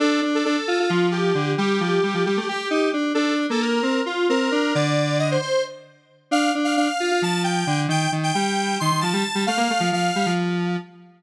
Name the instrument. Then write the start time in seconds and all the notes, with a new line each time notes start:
lead 1 (square)
0.00 D4 A4
0.22 D4
0.35 A4
0.45 D4 A4
0.68 F4
0.80 F4
0.89 F3 F4
1.11 G4
1.35 D3
1.58 G3 G4
1.81 F3
2.03 G3
2.14 F3
2.25 G3 G4
2.37 A3
2.49 G4
2.71 D#4
2.93 D4
3.14 D4 A4
3.50 A#3 A4
3.62 A#4
3.83 C4
4.06 F4
4.29 C4 A#4
4.52 D4
4.75 D3 D5
5.19 D#5
5.31 C5
5.42 C5
6.31 D4 F5
6.55 D4
6.64 F5
6.77 D4 F5
7.00 F4
7.11 F4
7.22 F3 A5
7.44 G5
7.67 D3
7.88 D#3 G5
8.12 D#3
8.23 G5
8.34 G3 G5
8.80 D#3 C6
8.91 D#3
9.01 F3 A5
9.13 G3
9.35 G3
9.47 A3 F5
9.57 A#3
9.70 A3
9.80 F3
9.92 F3 F5
10.16 G3
10.26 F3